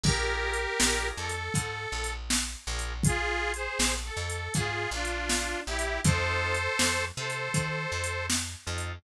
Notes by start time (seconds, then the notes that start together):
0.04 A#1 D4 F4 G4 G#4 A#4, kick, crash
0.53 closed hi-hat
0.79 A#1 D4 F4 G#4 A#4, snare
1.17 F2 A4
1.29 closed hi-hat
1.54 G#2, kick, closed hi-hat
1.92 A#1
2.04 closed hi-hat
2.30 snare
2.67 A#1 D4 F4 G#4 A#4
2.79 closed hi-hat
3.03 F4 G#4, kick, closed hi-hat
3.54 G#4 C5, closed hi-hat
3.79 A#1, snare
4.05 A4
4.17 F2
4.30 closed hi-hat
4.54 G#2 F4 G#4, kick, closed hi-hat
4.91 A#1 D4 F4
5.05 closed hi-hat
5.29 snare
5.67 A#1 E4 G4
5.79 closed hi-hat
6.04 F2 C4 D#4 F4 A4 C5, kick, closed hi-hat
6.55 closed hi-hat
6.79 F2, snare
7.17 C3 A4 C5
7.30 closed hi-hat
7.54 D#3, kick, closed hi-hat
7.92 F2
8.04 closed hi-hat
8.30 snare
8.66 F2 C4 D#4 F4 A4
8.78 closed hi-hat